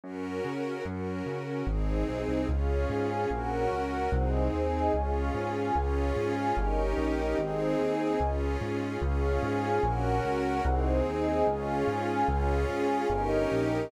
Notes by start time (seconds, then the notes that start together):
0.04 F#2 C#4 F#4 A#4
0.45 C#3
0.85 F#2 C#4 F#4 A#4
1.26 C#3
1.67 G#1 C4 D#4 G#4
2.08 B1
2.28 C2
2.49 C#2 C#4 F4 G#4 C#5 F5
2.89 G#2 G#4 F5 G#5
3.30 A#1 C#4 F#4 A#4 C#5 F#5
3.71 C#2 F#4 A#4 F#5
4.12 C2 C4 D#4 G#4 C5 D#5
4.53 D#2 G#4 D#5 G#5
4.94 C#2 C#4 F4 G#4 C#5 F5
5.34 G#2 G#4 F5 G#5
5.75 C#2 C#4 F4 G#4 C#5 F5
6.16 G#2 G#4 F5 G#5
6.57 G1 C#4 D#4 G4 A#4 C#5 D#5
6.98 A#1 G4 A#4 D#5 G5
7.38 G#1 C4 D#4 G#4 C5 D#5
7.79 D#2 G#4 D#5 G#5
8.20 C#2 C#4 F4 G#4
8.61 G#2
9.02 C#2 C#4 F4 G#4 C#5 F5
9.43 G#2 G#4 F5 G#5
9.83 A#1 C#4 F#4 A#4 C#5 F#5
10.24 C#2 F#4 A#4 F#5
10.65 C2 C4 D#4 G#4 C5 D#5
11.06 D#2 G#4 D#5 G#5
11.47 C#2 C#4 F4 G#4 C#5 F5
11.87 G#2 G#4 F5 G#5
12.28 C#2 C#4 F4 G#4 C#5 F5
12.69 G#2 G#4 F5 G#5
13.10 G1 C#4 D#4 G4 A#4 C#5 D#5
13.51 A#1 G4 A#4 D#5 G5